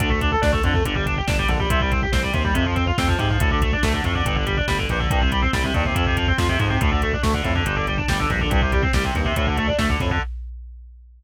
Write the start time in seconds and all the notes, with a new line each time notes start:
0.00 D2 D3, kick, closed hi-hat
0.10 A3, kick
0.21 D4, kick, closed hi-hat
0.32 A4, kick
0.42 D2 D4, kick, snare
0.52 A3, kick
0.63 F2 D3, kick, closed hi-hat
0.74 A3, kick
0.85 G1 D3, kick, closed hi-hat
0.95 G3, kick
1.06 D4, kick, closed hi-hat
1.17 G4, kick
1.27 G1 D4, kick, snare
1.38 G3, kick
1.48 A#1 D3, kick, closed hi-hat
1.59 G3, kick
1.70 C2 C3, kick, closed hi-hat
1.80 G3, kick
1.91 C4, kick, closed hi-hat
2.02 G4, kick
2.12 C2 C4, kick, snare
2.23 G3, kick
2.33 D#2 C3, kick, closed hi-hat
2.45 G3, kick
2.54 F2 C3, kick, closed hi-hat
2.66 F3, kick
2.76 C4, kick, closed hi-hat
2.87 F4, kick
2.98 F2 C4, kick, snare
3.08 F3, kick
3.19 G#2 C3, kick, closed hi-hat
3.30 F3, kick
3.40 D2 A2, kick, closed hi-hat
3.51 D3, kick
3.62 A3, kick, closed hi-hat
3.72 D4, kick
3.83 D2 A3, kick, snare
3.94 D3, kick
4.04 F2 A2, kick, closed hi-hat
4.15 D3, kick
4.25 G1 G2, kick, closed hi-hat
4.35 D3, kick
4.46 G3, kick, closed hi-hat
4.57 D4, kick
4.68 G1 G3, kick, snare
4.78 D3, kick
4.89 A#1 G2, kick, closed hi-hat
5.00 D3, kick
5.10 C2 G2, kick, closed hi-hat
5.21 C3, kick
5.32 G3, kick, closed hi-hat
5.42 C4, kick
5.53 C2 G3, kick, snare
5.64 C3, kick
5.74 D#2 G2, kick, closed hi-hat
5.85 C3, kick
5.95 F2, kick, closed hi-hat
6.06 C3, kick
6.17 F3, kick, closed hi-hat
6.28 C4, kick
6.38 F2 F3, kick, snare
6.49 C3, kick
6.59 F2 G#2, kick, closed hi-hat
6.70 C3, kick
6.81 D2 A2, kick, closed hi-hat
6.91 D3, kick
7.02 A3, kick, closed hi-hat
7.13 D4, kick
7.23 D2 A3, kick, snare
7.34 D3, kick
7.44 F2 A2, kick, closed hi-hat
7.55 D3, kick
7.66 G1 G2, kick, closed hi-hat
7.76 D3, kick
7.87 G3, kick, closed hi-hat
7.98 D4, kick
8.08 G1 G3, kick, snare
8.19 D3, kick
8.30 A#1 G2, kick, closed hi-hat
8.40 D3, kick
8.50 C2 G2, kick, closed hi-hat
8.62 C3, kick
8.72 G3, kick, closed hi-hat
8.82 C4, kick
8.93 C2 G3, kick, snare
9.04 C3, kick
9.15 D#2 G2, kick, closed hi-hat
9.25 C3, kick
9.36 D2 A2, kick, closed hi-hat
9.47 D3, kick
9.57 A3, kick, closed hi-hat
9.68 D4, kick
9.78 D2 A3, kick, snare
9.89 D3, kick
10.00 F2 A2, kick, closed hi-hat
10.11 D3, kick